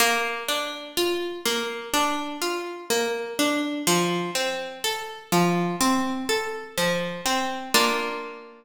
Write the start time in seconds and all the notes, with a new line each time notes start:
0.00 A#3
0.48 D4
0.97 F4
1.46 A#3
1.94 D4
2.42 F4
2.90 A#3
3.39 D4
3.87 F3
4.35 C4
4.84 A4
5.32 F3
5.81 C4
6.29 A4
6.78 F3
7.26 C4
7.74 A#3 D4 F4